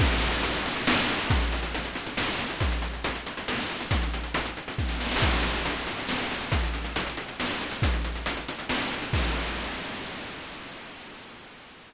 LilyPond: \new DrumStaff \drummode { \time 3/4 \tempo 4 = 138 <cymc bd>16 hh16 hh16 hh16 hh16 hh16 hh16 hh16 sn16 hh16 hh16 hh16 | <hh bd>16 hh16 hh16 hh16 hh16 hh16 hh16 hh16 sn16 hh16 hh16 hh16 | <hh bd>16 hh16 hh16 hh16 hh16 hh16 hh16 hh16 sn16 hh16 hh16 hh16 | <hh bd>16 hh16 hh16 hh16 hh16 hh16 hh16 hh16 <bd sn>16 sn16 sn32 sn32 sn32 sn32 |
<cymc bd>16 hh16 hh16 hh16 hh16 hh16 hh16 hh16 sn16 hh16 hh16 hh16 | <hh bd>16 hh16 hh16 hh16 hh16 hh16 hh16 hh16 sn16 hh16 hh16 hh16 | <hh bd>16 hh16 hh16 hh16 hh16 hh16 hh16 hh16 sn16 hh16 hh16 hh16 | <cymc bd>4 r4 r4 | }